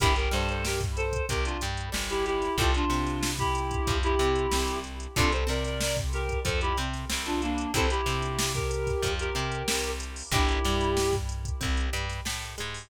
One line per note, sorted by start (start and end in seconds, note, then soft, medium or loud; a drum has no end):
0.00 0.29 G1 loud
0.00 0.13 D4 medium
0.00 0.15 E4 medium
0.00 0.13 E4 medium
0.00 0.15 G4 medium
0.00 0.13 G4 loud
0.00 0.13 A#4 loud
0.00 kick loud
0.00 closed hi-hat loud
0.16 0.31 G4 medium
0.16 0.31 A#4 medium
0.16 closed hi-hat medium
0.31 1.15 G2 medium
0.31 1.14 G3 medium
0.31 0.48 A4 medium
0.31 0.48 C5 medium
0.31 snare medium
0.31 closed hi-hat medium
0.49 0.64 A4 medium
0.49 0.64 C5 medium
0.49 closed hi-hat medium
0.65 0.80 G4 medium
0.65 0.80 A#4 medium
0.65 snare loud
0.81 kick medium
0.81 closed hi-hat medium
0.96 1.26 A4 medium
0.96 1.26 C5 medium
0.96 closed hi-hat medium
1.13 kick medium
1.13 closed hi-hat medium
1.29 1.57 C2 medium
1.29 1.57 C4 medium
1.29 1.44 G4 medium
1.29 1.44 A#4 medium
1.29 kick medium
1.29 closed hi-hat loud
1.45 1.60 D4 medium
1.45 1.60 F4 medium
1.45 closed hi-hat medium
1.61 1.90 G2 medium
1.61 1.89 G3 medium
1.61 closed hi-hat medium
1.77 closed hi-hat medium
1.92 2.49 G1 medium
1.92 2.47 G3 medium
1.92 snare loud
2.10 2.25 E4 medium
2.10 2.25 G4 medium
2.10 closed hi-hat medium
2.26 2.57 E4 medium
2.26 2.57 G4 medium
2.26 closed hi-hat medium
2.42 snare soft
2.42 closed hi-hat medium
2.58 2.85 C2 loud
2.58 2.71 C4 medium
2.58 2.71 E4 loud
2.58 2.73 F4 medium
2.58 2.71 G4 medium
2.58 2.73 A4 medium
2.58 2.71 A4 medium
2.58 kick loud
2.58 closed hi-hat medium
2.74 3.31 D4 medium
2.74 3.31 F4 medium
2.74 closed hi-hat medium
2.90 3.72 C3 medium
2.90 3.73 C4 medium
2.90 snare medium
2.90 closed hi-hat medium
3.07 snare soft
3.07 closed hi-hat medium
3.23 snare loud
3.39 3.97 E4 medium
3.39 3.97 G4 medium
3.39 kick medium
3.39 closed hi-hat medium
3.55 closed hi-hat medium
3.71 kick medium
3.71 closed hi-hat medium
3.87 4.15 F2 medium
3.87 4.15 F3 medium
3.87 kick loud
3.87 closed hi-hat medium
4.03 4.79 E4 medium
4.03 4.79 G4 medium
4.03 closed hi-hat medium
4.19 4.47 C3 medium
4.19 4.48 C4 medium
4.19 closed hi-hat medium
4.35 closed hi-hat medium
4.51 5.07 C2 medium
4.51 5.06 C4 medium
4.51 snare loud
4.68 closed hi-hat medium
4.84 closed hi-hat medium
5.00 closed hi-hat medium
5.16 5.44 C2 loud
5.16 5.29 C4 loud
5.16 5.29 D4 loud
5.16 5.32 F4 medium
5.16 5.29 F4 loud
5.16 5.29 A4 loud
5.16 5.32 A4 medium
5.16 kick loud
5.16 closed hi-hat loud
5.32 5.48 A4 medium
5.32 5.48 C5 medium
5.32 closed hi-hat medium
5.47 6.31 C3 medium
5.47 6.29 C4 medium
5.47 5.64 A#4 medium
5.47 5.64 D5 medium
5.47 snare medium
5.47 closed hi-hat medium
5.65 5.80 A#4 medium
5.65 5.80 D5 medium
5.65 snare soft
5.65 closed hi-hat medium
5.81 5.96 A#4 medium
5.81 5.96 D5 medium
5.81 snare loud
5.97 kick medium
5.97 closed hi-hat medium
6.13 6.40 G4 medium
6.13 6.40 A#4 medium
6.13 snare soft
6.13 closed hi-hat medium
6.29 kick medium
6.29 closed hi-hat medium
6.45 6.73 F2 medium
6.45 6.72 F3 medium
6.45 6.60 A4 medium
6.45 6.60 C5 medium
6.45 kick medium
6.45 closed hi-hat loud
6.61 6.77 E4 medium
6.61 6.77 G4 medium
6.61 closed hi-hat medium
6.77 7.05 C3 medium
6.77 7.05 C4 medium
6.77 closed hi-hat medium
6.94 snare soft
6.94 closed hi-hat medium
7.10 7.67 C2 medium
7.10 7.64 C4 medium
7.10 snare loud
7.26 7.41 D4 medium
7.26 7.41 F4 medium
7.26 closed hi-hat medium
7.42 7.71 A#3 medium
7.42 7.71 D4 medium
7.42 closed hi-hat medium
7.58 closed hi-hat medium
7.74 8.01 C2 medium
7.74 7.87 C4 medium
7.74 7.87 E4 loud
7.74 7.87 G4 medium
7.74 7.87 A4 loud
7.74 7.90 A4 medium
7.74 7.90 C5 medium
7.74 kick medium
7.74 closed hi-hat loud
7.90 8.52 E4 medium
7.90 8.52 G4 medium
7.90 closed hi-hat medium
8.06 8.88 C3 medium
8.06 8.89 C4 medium
8.06 snare medium
8.06 closed hi-hat medium
8.22 closed hi-hat medium
8.39 snare loud
8.54 9.12 G4 medium
8.54 9.12 A#4 medium
8.54 kick medium
8.54 closed hi-hat medium
8.71 closed hi-hat medium
8.87 kick medium
8.87 snare soft
8.87 closed hi-hat medium
9.02 9.30 F2 medium
9.02 9.32 F3 medium
9.02 kick medium
9.02 closed hi-hat loud
9.19 9.91 G4 medium
9.19 9.91 A#4 medium
9.19 closed hi-hat medium
9.35 9.63 C3 medium
9.35 9.62 C4 medium
9.35 closed hi-hat medium
9.52 closed hi-hat medium
9.68 10.23 C2 medium
9.68 10.23 C4 medium
9.68 snare loud
9.84 closed hi-hat medium
10.00 closed hi-hat medium
10.16 open hi-hat medium
10.31 10.59 G1 loud
10.31 10.60 D4 medium
10.31 11.15 E4 medium
10.31 10.60 E4 loud
10.31 10.60 G4 loud
10.31 11.15 G4 medium
10.31 10.60 A#4 loud
10.31 kick loud
10.31 closed hi-hat loud
10.49 closed hi-hat medium
10.65 11.47 G2 medium
10.65 11.48 G3 medium
10.65 snare medium
10.65 closed hi-hat medium
10.81 closed hi-hat medium
10.97 snare loud
11.13 kick medium
11.13 snare soft
11.13 closed hi-hat medium
11.29 closed hi-hat medium
11.45 kick medium
11.45 closed hi-hat medium
11.61 11.90 C2 medium
11.61 11.88 C4 medium
11.61 kick medium
11.61 closed hi-hat medium
11.77 closed hi-hat medium
11.93 12.21 G2 medium
11.93 12.20 G3 medium
11.93 closed hi-hat medium
12.10 snare soft
12.10 closed hi-hat medium
12.25 12.55 A2 medium
12.25 12.54 A3 medium
12.25 snare loud
12.42 closed hi-hat medium
12.58 12.89 G#2 medium
12.58 12.87 G#3 medium
12.58 closed hi-hat medium
12.74 open hi-hat medium